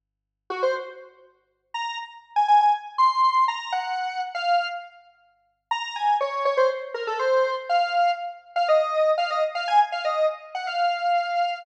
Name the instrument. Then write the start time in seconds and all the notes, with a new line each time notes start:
lead 1 (square)
0.50 F#4
0.63 C5
1.74 A#5
2.36 G#5
2.48 G#5
2.61 G#5
2.98 C6
3.48 A#5
3.72 F#5
4.35 F5
5.71 A#5
5.96 G#5
6.21 C#5
6.45 C#5
6.57 C5
6.94 A#4
7.07 A4
7.19 C5
7.69 F5
8.56 F5
8.68 D#5
9.18 F5
9.30 D#5
9.55 F5
9.68 G#5
9.92 F5
10.05 D#5
10.55 F#5
10.67 F5